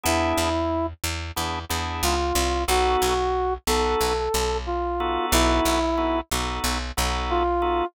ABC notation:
X:1
M:4/4
L:1/8
Q:1/4=91
K:B
V:1 name="Brass Section"
E3 z3 ^E2 | F3 =A3 =F2 | E3 z3 =F2 |]
V:2 name="Drawbar Organ"
[B,=DEG]4 [B,DEG] [B,DEG]3 | [B,DF=A]3 [B,DFA]4 [B,DFA]- | [B,DF=A]2 [B,DFA] [B,DFA]2 [B,DFA]2 [B,DFA] |]
V:3 name="Electric Bass (finger)" clef=bass
E,, E,,2 E,, E,, E,, C,, =C,, | B,,, B,,,2 B,,, B,,, B,,,3 | B,,, B,,,2 B,,, B,,, B,,,3 |]